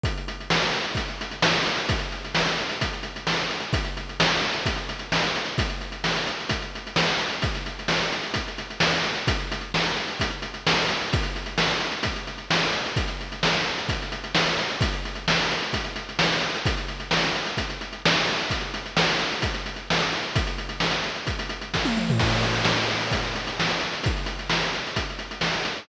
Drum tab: CC |----------------|----------------|----------------|----------------|
HH |xxxx-xxxxxxx-xxx|xxxx-xxxxxxx-xxx|xxxx-xxxxxxx-xxx|xxxx-xxxxxxx-xxx|
SD |----o-------o---|----o-------o---|----o-------o---|----o-------o---|
T1 |----------------|----------------|----------------|----------------|
T2 |----------------|----------------|----------------|----------------|
FT |----------------|----------------|----------------|----------------|
BD |o-------o-------|o-------o-------|o-------o-------|o-------o-------|

CC |----------------|----------------|----------------|----------------|
HH |xxxx-xxxxxxx-xxx|xxxx-xxxxxxx-xxx|xxxx-xxxxxxx-xxx|xxxx-xxxxxxx-xxx|
SD |----o-------o---|----o-------o---|----o-------o---|----o-------o---|
T1 |----------------|----------------|----------------|----------------|
T2 |----------------|----------------|----------------|----------------|
FT |----------------|----------------|----------------|----------------|
BD |o-------o-------|o-------o-------|o-------o-------|o-------o-------|

CC |----------------|----------------|----------------|----------------|
HH |xxxx-xxxxxxx-xxx|xxxx-xxxxxxx-xxx|xxxx-xxxxxxx-xxx|xxxx-xxxxxxx----|
SD |----o-------o---|----o-------o---|----o-------o---|----o-------o---|
T1 |----------------|----------------|----------------|-------------o--|
T2 |----------------|----------------|----------------|--------------o-|
FT |----------------|----------------|----------------|---------------o|
BD |o-------o-------|o-------o-------|o-------o-------|o-------o---o---|

CC |x---------------|----------------|
HH |-xxx-xxxxxxx-xxx|xxxx-xxxxxxx-xxx|
SD |----o-------o---|----o-------o---|
T1 |----------------|----------------|
T2 |----------------|----------------|
FT |----------------|----------------|
BD |o-------o-------|o-------o-------|